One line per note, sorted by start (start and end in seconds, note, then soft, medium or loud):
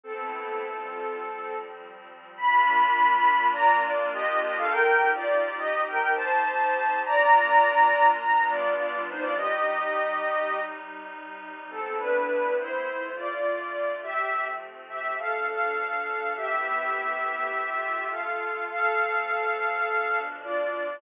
0.04 0.62 A3 medium
0.04 0.62 B3 medium
0.04 1.55 C4 loud
0.04 0.62 C4 medium
0.04 0.62 E4 medium
0.04 1.55 A4 loud
0.62 1.20 C3 medium
0.62 1.20 G3 medium
0.62 1.20 F4 medium
1.22 2.38 F3 medium
1.22 2.38 G3 medium
1.22 2.38 C4 medium
2.37 4.68 A#3 loud
2.37 4.68 D4 loud
2.37 4.68 F4 loud
2.37 3.46 B5 loud
3.53 3.80 D5 loud
3.53 3.80 A#5 loud
3.82 4.09 F4 loud
3.82 4.09 D5 loud
4.14 4.40 G4 loud
4.14 4.40 D#5 loud
4.42 4.56 G4 loud
4.42 4.56 D#5 loud
4.58 4.72 A4 loud
4.58 4.72 F5 loud
4.71 7.03 C4 medium
4.71 7.03 D#4 medium
4.71 7.03 G4 medium
4.71 5.08 A#4 loud
4.71 5.08 G5 loud
5.15 5.57 F4 loud
5.15 5.57 D5 loud
5.58 5.82 G4 loud
5.58 5.82 D#5 loud
5.88 6.13 A#4 loud
5.88 6.13 G5 loud
6.16 6.99 C5 loud
6.16 6.99 A5 loud
7.04 8.19 A#3 medium
7.04 8.19 D4 medium
7.04 8.19 F4 loud
7.04 8.08 D5 loud
7.04 8.08 A#5 loud
8.20 9.37 G3 loud
8.20 9.37 B3 medium
8.20 9.37 D4 medium
8.20 9.37 F4 medium
8.20 8.47 A#5 loud
8.49 8.74 F4 loud
8.49 8.74 D5 loud
8.77 9.02 F4 loud
8.77 9.02 D5 loud
9.09 9.23 D#4 loud
9.09 9.23 C5 loud
9.21 9.34 F4 loud
9.21 9.34 D5 loud
9.37 11.68 C3 loud
9.37 11.68 G3 medium
9.37 11.68 D#4 medium
9.37 10.60 G4 loud
9.37 10.60 D#5 loud
11.70 12.85 A3 medium
11.70 12.86 B3 medium
11.70 11.96 C4 loud
11.70 12.86 C4 medium
11.70 12.86 E4 medium
11.70 11.96 A4 loud
11.98 12.53 D4 loud
11.98 12.53 B4 loud
12.59 13.09 E4 loud
12.59 13.09 C5 loud
12.86 14.01 D3 medium
12.86 14.01 A3 medium
12.86 14.01 F4 medium
13.16 13.95 F4 medium
13.16 13.95 D5 loud
14.03 15.18 F3 medium
14.03 15.18 A3 medium
14.03 15.18 C4 medium
14.03 14.45 G4 loud
14.03 14.45 E5 loud
14.89 15.14 G4 medium
14.89 15.14 E5 loud
15.19 16.36 B2 medium
15.19 16.36 F3 medium
15.19 16.36 D4 medium
15.19 15.46 A4 loud
15.19 15.46 F5 loud
15.49 16.33 A4 loud
15.49 16.33 F5 loud
16.36 17.51 A3 medium
16.36 17.51 B3 medium
16.36 17.51 C4 medium
16.36 17.51 E4 medium
16.36 18.06 G4 loud
16.36 18.06 E5 loud
17.53 18.68 D3 medium
17.53 18.68 A3 medium
17.53 18.68 F4 medium
18.11 18.64 A4 medium
18.11 18.64 F5 medium
18.69 19.84 F3 medium
18.69 19.84 A3 medium
18.69 19.84 C4 medium
18.69 20.19 A4 loud
18.69 20.19 F5 loud
19.86 21.01 B2 medium
19.86 21.01 F3 medium
19.86 21.01 D4 medium
20.42 20.96 F4 medium
20.42 20.96 D5 loud